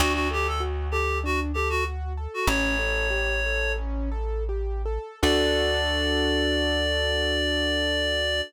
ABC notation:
X:1
M:4/4
L:1/16
Q:1/4=97
K:D
V:1 name="Clarinet"
F F G A z2 G2 F z G F z3 F | "^rit." c8 z8 | d16 |]
V:2 name="Acoustic Grand Piano"
D2 A2 F2 A2 D2 A2 F2 A2 | "^rit." C2 A2 G2 A2 C2 A2 G2 A2 | [DFA]16 |]
V:3 name="Electric Bass (finger)" clef=bass
D,,16 | "^rit." A,,,16 | D,,16 |]